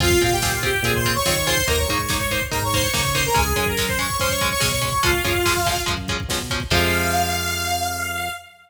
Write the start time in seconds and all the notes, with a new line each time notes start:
0.00 F2 C4 F4 G#4 F5, kick, crash
0.10 kick
0.21 A#2 C4 F4 G#4 F5, kick, closed hi-hat
0.32 G4 G5, kick
0.42 C4 F4 G#4, kick, snare
0.52 F4 F5, kick
0.63 C4 F4 G4 G#4 G5, kick, closed hi-hat
0.74 kick
0.82 A#2 C4 F4 G#4 G#5, kick, closed hi-hat
0.94 C5 C6, kick
1.04 C4 F4 G#4, kick, closed hi-hat
1.15 C#5 C#6, kick
1.25 D#3 C4 F4 G#4 C#5 C#6, kick, snare
1.35 C#5 C#6, kick
1.46 C4 F4 G#4 C5 C6, kick, open hi-hat
1.57 kick
1.68 D#2 A#3 D#4 A#4 A#5, kick, closed hi-hat
1.78 C#5 C#6, kick
1.88 G#2 A#3 D#4, kick, closed hi-hat
1.99 kick
2.09 A#3 D#4, kick, snare
2.19 C#5 C#6, kick
2.30 A#3 D#4 C5 C6, kick, closed hi-hat
2.41 kick
2.51 G#2 A#3 D#4 A#4 A#5, kick, closed hi-hat
2.62 C#5 C#6, kick
2.72 A#3 D#4 C5 C6, kick, closed hi-hat
2.82 C#5 C#6, kick
2.94 C#3 A#3 D#4 C#5 C#6, kick, snare
3.05 kick
3.14 A#3 D#4 C5 C6, kick, closed hi-hat
3.24 A#4 A#5, kick
3.34 C#2 G#3 C#4 G#4 G#5, kick, closed hi-hat
3.47 kick
3.56 F#2 G#3 C#4 G#4 G#5, kick, closed hi-hat
3.66 A#4 A#5, kick
3.77 G#3 C#4, kick, snare
3.88 C5 C6, kick
3.98 G#3 C#4 C#5 C#6, kick, closed hi-hat
4.10 kick
4.19 F#2 G#3 C#4 C5 C6, kick, closed hi-hat
4.29 C#5 C#6, kick
4.41 G#3 C#4, kick, closed hi-hat
4.51 C#5 C#6, kick
4.60 B2 G#3 C#4 C#5 C#6, kick, snare
4.72 C#5 C#6, kick
4.81 G#3 C#4 C#5 C#6, kick, closed hi-hat
4.92 kick
5.03 C#2 F3 G#3 C#4 F4 F5, kick, closed hi-hat
5.13 kick
5.24 F#2 F3 G#3 C#4, kick, closed hi-hat
5.35 kick
5.46 F3 G#3 C#4, kick, snare
5.57 kick
5.66 F3 G#3 C#4, kick, closed hi-hat
5.76 kick
5.86 F#2 F3 G#3 C#4, kick, closed hi-hat
5.97 kick
6.08 F3 G#3 C#4, kick, closed hi-hat
6.20 kick
6.28 B2 F3 G#3 C#4, kick, snare
6.40 kick
6.50 F3 G#3 C#4, kick, closed hi-hat
6.60 kick
6.70 F2 C3 F3 G#3 F5, kick, crash